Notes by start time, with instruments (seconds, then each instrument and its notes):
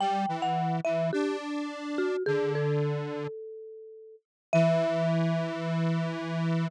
0.00 lead 1 (square) G3, marimba G5
0.28 lead 1 (square) E3
0.42 marimba F#5
0.85 lead 1 (square) E3, marimba E5
1.13 lead 1 (square) D4, marimba G4
1.98 marimba F#4
2.26 lead 1 (square) D3, marimba G#4
2.55 marimba A4
4.53 lead 1 (square) E3, marimba E5